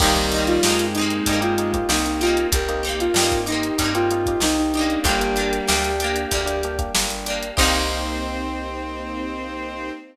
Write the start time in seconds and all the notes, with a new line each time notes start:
0.00 C2 D#3 G3 A#3 C4 D#4 G4, kick, crash
0.06 A#3
0.16 A#3 C4 D#4 G4, kick, closed hi-hat
0.32 D#4 G4, closed hi-hat
0.36 A#3 C4
0.47 F4, closed hi-hat
0.63 G2 G#3 A#3 C4 D#4 G4, snare
0.68 A#3 C4
0.79 closed hi-hat
0.94 D#4 G4, closed hi-hat
0.99 A#3 C4
1.10 closed hi-hat
1.26 G2 D#4 G4, kick, closed hi-hat
1.31 A#3 C4
1.41 A#3 C4 D#4 F4 G4, closed hi-hat
1.58 A#3 C4 D#4 G4, closed hi-hat
1.74 A#3 C4 D#4 G4, kick, closed hi-hat
1.89 C2 A#3 C4 D#4 G4, snare
2.06 D#4, closed hi-hat
2.21 C4 D#4 F4 G4, closed hi-hat
2.27 A#3
2.37 closed hi-hat
2.52 C2 A#3 C4 G4 A#4, kick, closed hi-hat
2.69 A#3 C4 D#4 G4, closed hi-hat
2.83 C4 D#4 G4 A#4, closed hi-hat
2.89 A#3
3.00 F4, closed hi-hat
3.14 G2 A#3 C4 D#4 G4, snare
3.19 A#3 C4 D#4
3.32 kick, closed hi-hat
3.46 C4 D#4 G4, closed hi-hat
3.52 A#3
3.63 closed hi-hat
3.78 G2 C4 D#4 G4, kick, closed hi-hat
3.84 A#3
3.95 A#3 C4 D#4 F4 G4, closed hi-hat
4.11 A#3 C4 D#4 G4, closed hi-hat
4.26 A#3 C4 D#4 G4, kick, closed hi-hat
4.40 C2 A#3 C4 D#4 G4, snare
4.58 D#4
4.74 D4 D#4 G4, closed hi-hat
4.79 A#3 C4
4.90 closed hi-hat
5.04 G1 G3 A#3 D4 G4, kick, closed hi-hat
5.08 A#3
5.21 A#3 D4 G4, closed hi-hat
5.36 A#3 D4 G4, closed hi-hat
5.53 closed hi-hat
5.68 D2 A#3 D4 G4, snare
5.84 closed hi-hat
6.00 D4 G4, closed hi-hat
6.04 A#3
6.16 closed hi-hat
6.31 D2 G3 A#3 D4 G4, kick, closed hi-hat
6.46 A#3 D4 G4, closed hi-hat
6.63 A#3 D4 G4, closed hi-hat
6.79 A#3 D4 G4, kick, closed hi-hat
6.95 G1 A#3 D4 G4, snare
7.10 closed hi-hat
7.26 A#3 D4 G4, closed hi-hat
7.43 closed hi-hat
7.57 C2 A#3 C4 D#4 G4 C5, kick, crash
7.63 A#3